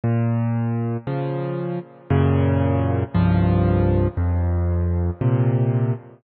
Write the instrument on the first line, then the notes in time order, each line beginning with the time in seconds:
acoustic grand piano
0.04 A#2
1.07 C#3 F3
2.10 F#2 A#2 C#3
3.14 C2 G2 F3
4.17 F2
5.21 A#2 C3